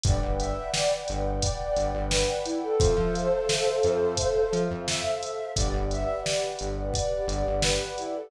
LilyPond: <<
  \new Staff \with { instrumentName = "Flute" } { \time 4/4 \key a \minor \tempo 4 = 87 d''16 r16 e''8 d''16 r8. d''4 b'8 e'16 a'16 | <a' c''>2. e''4 | d''16 r16 e''8 d''16 r8. d''4 b'8 e'16 a'16 | }
  \new Staff \with { instrumentName = "Pad 2 (warm)" } { \time 4/4 \key a \minor <b' d'' fis'' g''>1 | <a' c'' e'' f''>1 | <g' b' d'' fis''>1 | }
  \new Staff \with { instrumentName = "Synth Bass 1" } { \clef bass \time 4/4 \key a \minor g,,16 g,,4~ g,,16 g,,4 g,,16 g,,4~ g,,16 | f,16 f4~ f16 f,4 f16 f,4~ f,16 | g,,16 g,,4~ g,,16 g,,4 g,,16 g,,4~ g,,16 | }
  \new DrumStaff \with { instrumentName = "Drums" } \drummode { \time 4/4 <hh bd>8 hh8 sn8 hh8 <hh bd>8 hh8 sn8 hh8 | <hh bd>8 hh8 sn8 hh8 <hh bd>8 hh8 sn8 hh8 | <hh bd>8 hh8 sn8 hh8 <hh bd>8 hh8 sn8 hh8 | }
>>